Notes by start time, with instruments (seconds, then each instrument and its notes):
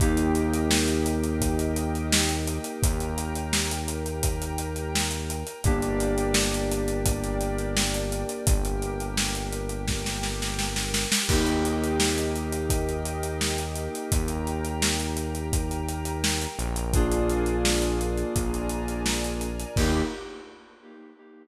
0.00 synth bass 1 D#2, electric piano 2 A#3 D#4 G4, pad 5 (bowed) A#4 D#5 G5, kick, closed hi-hat
0.17 closed hi-hat
0.35 closed hi-hat
0.54 closed hi-hat
0.71 snare
0.88 closed hi-hat
1.06 closed hi-hat
1.24 closed hi-hat
1.41 kick, closed hi-hat
1.59 closed hi-hat
1.76 closed hi-hat
1.95 closed hi-hat
2.12 snare
2.29 closed hi-hat
2.47 closed hi-hat
2.64 closed hi-hat
2.83 synth bass 1 D#2, pad 5 (bowed) A#4 G5 A#5, kick, closed hi-hat
3.00 closed hi-hat
3.18 closed hi-hat
3.35 closed hi-hat
3.53 snare
3.71 closed hi-hat
3.88 closed hi-hat
4.06 closed hi-hat
4.23 kick, closed hi-hat
4.42 closed hi-hat
4.58 closed hi-hat
4.76 closed hi-hat
4.95 snare
5.11 closed hi-hat
5.30 closed hi-hat
5.47 closed hi-hat
5.64 synth bass 1 G1, electric piano 2 A#3 D4 G4, pad 5 (bowed) A#4 D5 G5, kick, closed hi-hat
5.82 closed hi-hat
6.00 closed hi-hat
6.18 closed hi-hat
6.34 snare
6.54 closed hi-hat
6.71 closed hi-hat
6.88 closed hi-hat
7.06 kick, closed hi-hat
7.24 closed hi-hat
7.41 closed hi-hat
7.59 closed hi-hat
7.77 snare
7.94 closed hi-hat
8.12 closed hi-hat
8.29 closed hi-hat
8.46 synth bass 1 G1, pad 5 (bowed) G4 A#4 G5, kick, closed hi-hat
8.65 closed hi-hat
8.82 closed hi-hat
9.00 closed hi-hat
9.17 snare
9.35 closed hi-hat
9.52 closed hi-hat
9.69 closed hi-hat
9.87 kick, snare
10.06 snare
10.23 snare
10.42 snare
10.59 snare
10.76 snare
10.94 snare
11.12 snare
11.28 synth bass 1 D#2, electric piano 2 A#3 D#4 G4, pad 5 (bowed) A#4 D#5 G5, kick, crash
11.47 closed hi-hat
11.65 closed hi-hat
11.84 closed hi-hat
12.00 snare
12.18 closed hi-hat
12.36 closed hi-hat
12.52 closed hi-hat
12.70 kick, closed hi-hat
12.89 closed hi-hat
13.05 closed hi-hat
13.23 closed hi-hat
13.41 snare
13.58 closed hi-hat
13.76 closed hi-hat
13.95 closed hi-hat
14.12 synth bass 1 D#2, pad 5 (bowed) A#4 G5 A#5, kick, closed hi-hat
14.28 closed hi-hat
14.47 closed hi-hat
14.65 closed hi-hat
14.82 snare
15.00 closed hi-hat
15.17 closed hi-hat
15.35 closed hi-hat
15.53 kick, closed hi-hat
15.71 closed hi-hat
15.89 closed hi-hat
16.05 closed hi-hat
16.24 snare
16.41 closed hi-hat
16.59 synth bass 1 A#1, closed hi-hat
16.76 closed hi-hat
16.94 electric piano 2 A#3 D4 F4 G#4, pad 5 (bowed) A#4 D5 F5 G#5, kick, closed hi-hat
17.12 closed hi-hat
17.30 closed hi-hat
17.46 closed hi-hat
17.65 snare
17.82 closed hi-hat
18.01 closed hi-hat
18.17 closed hi-hat
18.35 synth bass 1 A#1, pad 5 (bowed) A#4 D5 G#5 A#5, kick, closed hi-hat
18.54 closed hi-hat
18.69 closed hi-hat
18.88 closed hi-hat
19.06 snare
19.24 closed hi-hat
19.41 closed hi-hat
19.60 closed hi-hat
19.76 synth bass 1 D#2, electric piano 2 A#3 D#4 G4, pad 5 (bowed) A#3 D#4 G4, kick, crash